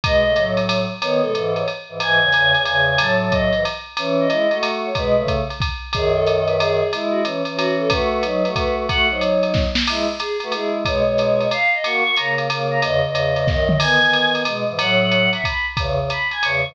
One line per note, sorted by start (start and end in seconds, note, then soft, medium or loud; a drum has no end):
0.04 0.23 B2 medium
0.04 0.23 G#3 loud
0.04 0.45 D#5 medium
0.04 kick medium
0.04 ride loud
0.26 0.35 C#3 medium
0.26 0.35 A3 medium
0.36 0.85 A2 medium
0.36 0.85 F#3 loud
0.36 hi-hat pedal medium
0.36 ride medium
0.57 ride medium
0.69 ride loud
1.01 1.21 D#3 medium
1.01 1.21 B3 loud
1.01 1.21 C#5 medium
1.01 ride loud
1.21 1.33 B2 medium
1.21 1.33 G#3 medium
1.21 1.52 A4 medium
1.34 1.63 G#2 medium
1.34 1.63 E3 medium
1.34 hi-hat pedal medium
1.34 ride medium
1.56 1.67 C#5 medium
1.56 ride medium
1.68 ride medium
1.89 2.00 G#2 medium
1.89 2.00 E3 medium
2.00 2.20 G#2 medium
2.00 2.20 E3 loud
2.00 2.18 G#5 medium
2.00 ride loud
2.20 2.30 E2 medium
2.20 2.30 C#3 loud
2.20 2.60 G#5 medium
2.32 2.52 E2 medium
2.32 2.52 C#3 medium
2.32 hi-hat pedal medium
2.32 ride medium
2.54 2.64 E2 medium
2.54 2.64 C#3 loud
2.54 ride medium
2.64 2.96 E2 medium
2.64 2.96 C#3 medium
2.64 2.83 G#5 medium
2.64 ride medium
2.89 2.98 G#5 medium
2.97 3.50 A2 medium
2.97 3.50 F#3 loud
2.97 3.17 A5 medium
2.97 ride loud
3.22 3.33 A5 medium
3.31 3.63 D#5 medium
3.31 kick medium
3.31 hi-hat pedal medium
3.31 ride medium
3.53 3.64 G#2 medium
3.53 3.64 E3 medium
3.53 ride medium
3.65 ride medium
3.97 4.27 E3 loud
3.97 4.27 C#4 loud
3.97 ride loud
4.20 4.58 D#5 medium
4.29 4.47 G#3 medium
4.29 4.47 E4 medium
4.29 hi-hat pedal medium
4.29 ride medium
4.51 4.90 A3 medium
4.51 4.90 F#4 medium
4.51 ride medium
4.63 ride loud
4.85 4.95 C#5 medium
4.95 5.16 B2 loud
4.95 5.16 G#3 loud
4.95 5.28 B4 medium
4.95 kick medium
4.95 ride medium
5.16 5.42 C#3 medium
5.16 5.42 A3 medium
5.28 kick medium
5.28 hi-hat pedal medium
5.28 ride medium
5.50 ride medium
5.60 kick medium
5.60 ride medium
5.93 6.82 F#2 loud
5.93 6.82 D#3 loud
5.93 6.12 G#4 medium
5.93 kick medium
5.93 ride loud
6.14 6.40 A4 medium
6.27 hi-hat pedal medium
6.27 ride medium
6.46 6.56 B4 medium
6.46 ride medium
6.59 6.91 G#4 medium
6.59 ride loud
6.93 7.23 G#3 medium
6.93 7.23 E4 loud
6.93 ride medium
7.11 7.20 F#4 medium
7.24 7.42 E3 medium
7.24 7.42 C#4 medium
7.24 hi-hat pedal medium
7.24 ride medium
7.45 7.90 E3 medium
7.45 7.90 C#4 medium
7.45 ride medium
7.56 7.75 F#4 medium
7.56 ride loud
7.79 7.90 A4 medium
7.89 8.23 A3 loud
7.89 8.23 F#4 loud
7.89 8.09 B4 medium
7.89 kick medium
7.89 ride loud
8.11 8.49 B4 medium
8.23 8.43 F#3 medium
8.23 8.43 D#4 loud
8.23 hi-hat pedal medium
8.23 ride medium
8.45 8.86 A3 medium
8.45 8.86 F#4 medium
8.45 ride medium
8.56 8.74 B4 medium
8.56 kick medium
8.56 ride medium
8.75 8.86 B4 medium
8.88 9.07 A3 medium
8.88 9.07 F#4 loud
8.88 9.06 F#5 medium
8.88 kick medium
8.88 ride medium
9.09 9.65 F#3 medium
9.09 9.65 D#4 medium
9.09 9.22 C5 medium
9.20 9.41 C#5 medium
9.20 hi-hat pedal medium
9.20 ride medium
9.42 9.53 C#5 medium
9.42 ride medium
9.54 kick medium
9.54 snare medium
9.75 snare loud
9.87 10.06 G#3 loud
9.87 10.06 E4 loud
9.87 crash loud
9.87 ride loud
10.20 10.37 G#4 medium
10.20 hi-hat pedal loud
10.20 ride medium
10.40 10.53 A3 medium
10.40 10.53 F#4 loud
10.40 10.53 B4 medium
10.40 ride medium
10.52 10.83 G#3 medium
10.52 10.83 E4 medium
10.52 10.71 G#4 medium
10.52 ride medium
10.85 11.03 B2 loud
10.85 11.03 G#3 loud
10.85 11.06 C#5 medium
10.85 kick medium
10.85 ride loud
11.05 11.47 B2 medium
11.05 11.47 G#3 loud
11.05 11.46 C#5 medium
11.18 hi-hat pedal medium
11.18 ride medium
11.41 ride medium
11.51 11.70 F5 medium
11.51 ride medium
11.74 11.83 D#5 medium
11.83 12.03 A#3 loud
11.83 12.03 F#4 loud
11.83 12.14 C#6 medium
11.83 ride medium
12.04 12.15 A#3 medium
12.04 12.15 F#4 medium
12.16 12.48 C#3 medium
12.16 12.48 A#3 medium
12.16 12.35 A#5 medium
12.16 hi-hat pedal medium
12.16 ride medium
12.38 ride medium
12.49 12.80 C#3 medium
12.49 12.80 A#3 loud
12.49 ride loud
12.71 12.80 A#5 medium
12.81 13.00 E2 loud
12.81 13.00 C#3 loud
12.81 13.00 D#5 medium
12.81 ride loud
13.03 13.47 E2 medium
13.03 13.47 C#3 medium
13.03 13.47 D#5 medium
13.15 hi-hat pedal medium
13.15 ride medium
13.36 ride medium
13.46 13.77 F#2 medium
13.46 13.77 D#3 medium
13.46 13.64 D#5 medium
13.46 kick medium
13.46 snare medium
13.68 13.78 D#5 medium
13.68 mid tom medium
13.78 13.99 D#3 medium
13.78 13.99 B3 loud
13.78 14.30 G#5 medium
13.78 crash loud
13.78 ride loud
14.01 14.43 D#3 medium
14.01 14.43 B3 medium
14.13 hi-hat pedal medium
14.13 ride medium
14.35 ride medium
14.45 14.64 B2 medium
14.45 14.64 G#3 loud
14.45 ride loud
14.68 14.79 G#2 medium
14.68 14.79 E3 loud
14.78 15.28 A2 loud
14.78 15.28 F#3 loud
14.78 14.99 F#5 medium
14.78 ride loud
15.02 15.29 F#5 medium
15.11 hi-hat pedal medium
15.11 ride medium
15.33 15.44 E5 medium
15.33 ride medium
15.44 15.66 B5 medium
15.44 kick medium
15.44 ride medium
15.77 15.98 E2 loud
15.77 15.98 C#3 loud
15.77 kick medium
15.77 ride loud
16.00 16.09 E2 medium
16.00 16.09 C#3 medium
16.10 16.28 B5 medium
16.10 hi-hat pedal medium
16.10 ride medium
16.31 16.42 G#5 medium
16.31 ride medium
16.42 16.63 E2 medium
16.42 16.63 C#3 medium
16.42 16.63 C#6 medium
16.42 ride loud
16.66 16.75 G#2 medium
16.66 16.75 E3 loud